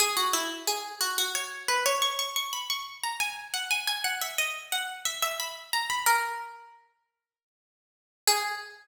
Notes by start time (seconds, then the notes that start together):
0.00 G#4
0.17 F#4
0.33 E4
0.67 G#4
1.01 F#4
1.18 F#4
1.35 C#5
1.68 B4
1.86 C#5
2.02 C#6
2.19 C#6
2.36 C#6
2.53 B5
2.70 C#6
3.04 A#5
3.20 G#5
3.54 F#5
3.71 G#5
3.87 G#5
4.04 F#5
4.21 E5
4.38 D#5
4.72 F#5
5.05 E5
5.22 E5
5.40 B5
5.73 A#5
5.90 B5
6.06 A#4
8.27 G#4